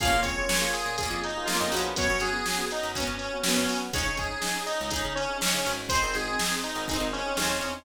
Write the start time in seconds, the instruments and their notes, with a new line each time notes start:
0.00 electric bass (finger) A#1, electric piano 2 A#3 C#4 F4 G#4, acoustic guitar (steel) F4 G#4, lead 1 (square) F5, kick, closed hi-hat
0.05 acoustic guitar (steel) A#3 C#4
0.12 electric bass (finger) A#2, electric piano 2 A#3 C#4 F4 G#4
0.22 electric bass (finger) F2, electric piano 2 A#3 C#4 F4 G#4, lead 1 (square) C#5, kick, closed hi-hat
0.37 electric piano 2 A#3 C#4 F4 G#4
0.49 electric piano 2 A#3 C#4 F4 G#4, snare
0.61 electric piano 2 A#3 C#4 F4 G#4
0.73 lead 1 (square) G#4, closed hi-hat
0.86 electric bass (finger) A#2
0.98 acoustic guitar (steel) F4 G#4, lead 1 (square) G#4, kick, closed hi-hat
1.03 acoustic guitar (steel) A#3 C#4
1.11 electric bass (finger) F2
1.24 lead 1 (square) D#4, closed hi-hat
1.36 electric piano 2 A#3 C#4 F4 G#4
1.45 electric piano 2 A#3 C#4 F4 G#4, lead 1 (square) F4, acoustic guitar (steel) G#4, snare
1.50 acoustic guitar (steel) C#4 F4
1.54 acoustic guitar (steel) A#3
1.60 electric bass (finger) F2, lead 1 (square) D#4
1.72 electric bass (finger) A#1, electric piano 2 A#3 C#4 F4 G#4, acoustic guitar (steel) C#4 F#4, closed hi-hat
1.76 acoustic guitar (steel) B3
1.96 electric bass (finger) F#2, electric piano 2 B3 C#4 F#4, lead 1 (square) C#5, kick, closed hi-hat
2.08 electric bass (finger) F#2, electric piano 2 B3 C#4 F#4
2.20 electric bass (finger) F#2, electric piano 2 B3 C#4 F#4, lead 1 (square) G#4, closed hi-hat
2.33 electric piano 2 B3 C#4 F#4
2.46 electric piano 2 B3 C#4 F#4, snare
2.58 electric piano 2 B3 C#4 F#4
2.71 lead 1 (square) D#4, closed hi-hat
2.83 electric bass (finger) F#2
2.95 lead 1 (square) C#4, acoustic guitar (steel) C#4 F#4, kick, closed hi-hat
3.00 acoustic guitar (steel) B3
3.07 electric bass (finger) F#2
3.18 lead 1 (square) C#4, closed hi-hat
3.33 electric piano 2 B3 C#4 F#4
3.43 electric piano 2 B3 C#4 F#4, lead 1 (square) C#4, acoustic guitar (steel) C#4 F#4, snare
3.48 acoustic guitar (steel) B3
3.56 electric bass (finger) F#2, lead 1 (square) C#4
3.68 electric bass (finger) F#3, electric piano 2 B3 C#4 F#4, open hi-hat
3.93 electric bass (finger) C#2, electric piano 2 C#4 D#4 G#4, acoustic guitar (steel) D#4 G#4, lead 1 (square) C#5, kick, closed hi-hat
3.98 acoustic guitar (steel) C#4
4.06 electric bass (finger) C#3, electric piano 2 C#4 D#4 G#4
4.17 electric bass (finger) G#2, electric piano 2 C#4 D#4 G#4, lead 1 (square) G#4, kick, closed hi-hat
4.31 electric piano 2 C#4 D#4 G#4
4.41 electric piano 2 C#4 D#4 G#4, snare
4.55 electric piano 2 C#4 D#4 G#4
4.66 lead 1 (square) D#4, closed hi-hat
4.81 electric bass (finger) C#2
4.90 lead 1 (square) D#4, acoustic guitar (steel) D#4 G#4, kick, closed hi-hat
4.96 acoustic guitar (steel) C#4
5.05 electric bass (finger) C#3
5.15 lead 1 (square) C#4, closed hi-hat
5.29 electric piano 2 C#4 D#4 G#4
5.40 electric piano 2 C#4 D#4 G#4, lead 1 (square) C#4, acoustic guitar (steel) D#4 G#4, snare
5.46 acoustic guitar (steel) C#4
5.53 electric bass (finger) C#3, lead 1 (square) C#4
5.66 electric bass (finger) G#1, electric piano 2 C#4 D#4 G#4, closed hi-hat
5.89 electric piano 2 C4 D#4 G#4, acoustic guitar (steel) D#4 G#4, lead 1 (square) C5, kick, closed hi-hat
5.95 acoustic guitar (steel) C4
6.02 electric bass (finger) G#1, electric piano 2 C4 D#4 G#4
6.14 electric bass (finger) G#1, electric piano 2 C4 D#4 G#4, lead 1 (square) G#4, closed hi-hat
6.28 electric piano 2 C4 D#4 G#4
6.39 electric piano 2 C4 D#4 G#4, snare
6.50 electric piano 2 C4 D#4 G#4
6.64 lead 1 (square) D#4, closed hi-hat
6.75 electric bass (finger) G#1
6.88 lead 1 (square) D#4, acoustic guitar (steel) D#4 G#4, kick, closed hi-hat
6.93 acoustic guitar (steel) C4
7.00 electric bass (finger) G#1
7.13 lead 1 (square) C#4, closed hi-hat
7.26 electric piano 2 C4 D#4 G#4
7.37 electric bass (finger) D#2, electric piano 2 C4 D#4 G#4, lead 1 (square) C#4, acoustic guitar (steel) D#4 G#4, snare
7.42 acoustic guitar (steel) C4
7.50 lead 1 (square) C#4
7.61 electric bass (finger) E2, electric piano 2 C4 D#4 G#4, closed hi-hat